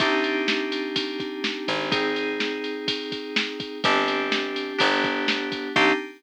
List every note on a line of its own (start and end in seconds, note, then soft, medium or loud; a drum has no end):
0.00 1.59 C2 medium
0.00 1.89 C4 medium
0.00 1.89 D4 medium
0.00 1.89 D#4 medium
0.00 1.89 G4 medium
0.00 kick loud
0.00 ride loud
0.24 ride medium
0.48 snare loud
0.72 ride medium
0.96 kick medium
0.96 ride loud
1.20 kick medium
1.20 ride medium
1.44 snare loud
1.68 3.69 G#1 medium
1.68 kick medium
1.68 ride medium
1.91 3.79 C4 medium
1.91 3.79 D#4 medium
1.91 3.79 G#4 medium
1.91 kick loud
1.91 ride loud
2.16 ride medium
2.40 snare loud
2.64 ride medium
2.88 kick loud
2.88 ride loud
3.12 kick medium
3.12 ride medium
3.36 snare loud
3.60 kick medium
3.60 ride medium
3.84 4.73 G1 loud
3.84 4.79 C4 medium
3.84 4.78 D4 medium
3.84 4.78 G4 medium
3.84 kick loud
3.84 ride loud
4.08 ride medium
4.32 snare loud
4.56 ride medium
4.78 5.69 G1 loud
4.78 5.72 B3 medium
4.78 5.72 D4 medium
4.78 5.72 G4 medium
4.78 kick loud
4.78 ride loud
5.04 kick loud
5.04 ride medium
5.28 snare loud
5.52 kick medium
5.52 ride medium
5.76 5.93 C2 loud
5.76 5.93 C4 loud
5.76 5.93 D4 loud
5.76 5.93 D#4 loud
5.76 5.93 G4 loud
5.76 kick loud
5.76 crash loud